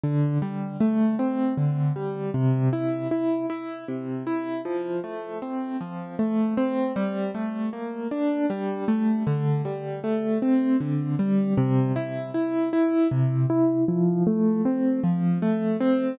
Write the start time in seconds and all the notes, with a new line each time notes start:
0.04 D3
0.42 G3
0.80 A3
1.19 C4
1.58 D3
1.96 G3
2.34 C3
2.73 E4
3.11 E4
3.50 E4
3.88 C3
4.27 E4
4.65 F3
5.04 A3
5.42 C4
5.81 F3
6.19 A3
6.57 C4
6.96 G3
7.35 A3
7.73 A#3
8.11 D4
8.50 G3
8.88 A3
9.27 D3
9.65 G3
10.04 A3
10.42 C4
10.81 D3
11.19 G3
11.58 C3
11.96 E4
12.34 E4
12.73 E4
13.11 C3
13.50 E4
13.88 F3
14.27 A3
14.65 C4
15.04 F3
15.42 A3
15.81 C4